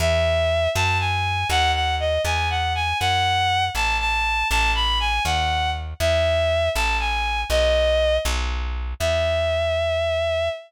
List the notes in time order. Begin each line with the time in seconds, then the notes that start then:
0.00 E2 E5
0.75 F#2 A5
1.00 G#5
1.49 D#2 F#5
1.75 F#5
2.00 D#5
2.25 E2 G#5
2.50 F#5
2.75 G#5
3.00 F#2 F#5
3.75 A1 A5
4.00 A5
4.50 A1 A5
4.75 B5
5.00 G#5
5.25 D#2 F#5
6.00 E2 E5
6.75 A1 A5
7.00 G#5
7.50 B1 D#5
8.25 B1
9.00 E2 E5